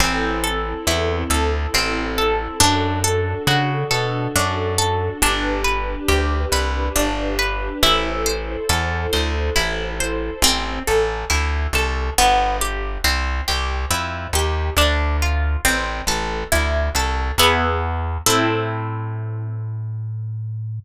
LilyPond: <<
  \new Staff \with { instrumentName = "Orchestral Harp" } { \time 3/4 \key a \minor \tempo 4 = 69 c'8 a'8 e'8 a'8 c'8 a'8 | d'8 a'8 fis'8 a'8 d'8 a'8 | d'8 b'8 g'8 b'8 d'8 b'8 | e'8 c''8 a'8 c''8 e'8 c''8 |
c'8 a'8 e'8 a'8 b8 g'8 | c'8 g'8 e'8 g'8 d'8 f'8 | c'8 a'8 e'8 a'8 <b e' gis'>4 | <c' e' a'>2. | }
  \new Staff \with { instrumentName = "Electric Bass (finger)" } { \clef bass \time 3/4 \key a \minor a,,4 e,8 d,8 a,,4 | fis,4 des8 b,8 fis,4 | g,,4 d,8 c,8 g,,4 | a,,4 e,8 d,8 a,,4 |
a,,8 a,,8 d,8 c,8 g,,4 | c,8 c,8 f,8 ees,8 d,4 | a,,8 a,,8 d,8 c,8 e,4 | a,2. | }
  \new Staff \with { instrumentName = "String Ensemble 1" } { \time 3/4 \key a \minor <c' e' a'>2. | <d' fis' a'>2. | <d' g' b'>2. | <e' a' c''>2. |
r2. | r2. | r2. | r2. | }
>>